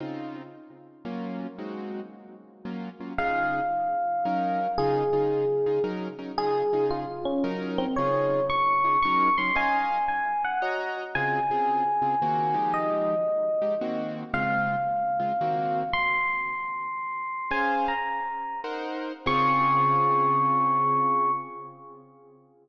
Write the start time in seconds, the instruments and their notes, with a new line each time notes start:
0.00 acoustic grand piano C#3 C4 D#4 F4
1.05 acoustic grand piano F#3 A#3 C#4 F4
1.58 acoustic grand piano G#3 C4 D#4 F#4
2.65 acoustic grand piano F#3 A#3 C#4 F4
3.00 acoustic grand piano F#3 A#3 C#4 F4
3.18 acoustic grand piano C#3 D#4 F4 G#4, electric piano 1 F5
4.25 acoustic grand piano F#3 C#4 D#4 A#4
4.78 acoustic grand piano C#3 D#4 F4 G#4, electric piano 1 G#4
5.13 acoustic grand piano C#3 D#4 F4 G#4
5.66 acoustic grand piano C#3 D#4 F4 G#4
5.84 acoustic grand piano F#3 C#4 D#4 A#4
6.18 acoustic grand piano F#3 C#4 D#4 A#4
6.38 acoustic grand piano C#3 D#4 F4 G#4, electric piano 1 G#4
6.73 acoustic grand piano C#3 D#4 F4 G#4
6.90 electric piano 1 F4
7.25 electric piano 1 C#4
7.44 acoustic grand piano F#3 C#4 D#4 A#4
7.78 electric piano 1 C4
7.96 acoustic grand piano C#3 D#4 F4 G#4, electric piano 1 C#5
8.50 electric piano 1 C#6
8.84 acoustic grand piano C#3 D#4 F4 G#4
9.02 acoustic grand piano F#3 C#4 D#4 A#4, electric piano 1 C#6
9.38 acoustic grand piano F#3 C#4 D#4 A#4, electric piano 1 C6
9.55 acoustic grand piano C#4 D#5 F5 G#5, electric piano 1 G#5
10.08 electric piano 1 G#5
10.44 electric piano 1 F#5
10.62 acoustic grand piano F#4 C#5 D#5 A#5
11.15 acoustic grand piano C#3 C4 F4 G#4, electric piano 1 G#5
11.51 acoustic grand piano C#3 C4 F4 G#4
12.02 acoustic grand piano C#3 C4 F4 G#4
12.22 acoustic grand piano D#3 A#3 C4 F#4
12.54 acoustic grand piano F3 G#3 D#4 G4
12.74 electric piano 1 D#5
13.62 acoustic grand piano F3 G#3 D#4 G4
13.81 acoustic grand piano D#3 A#3 C4 F#4
14.33 acoustic grand piano C#3 G#3 C4 F4, electric piano 1 F5
15.19 acoustic grand piano C#3 G#3 C4 F4
15.41 acoustic grand piano D#3 A#3 C4 F#4
15.93 electric piano 1 C6
17.51 acoustic grand piano C#4 G#4 C5 F5, electric piano 1 G#5
17.88 electric piano 1 A#5
18.64 acoustic grand piano D#4 A#4 C5 F#5
19.26 acoustic grand piano C#3 C4 F4 G#4, electric piano 1 C#6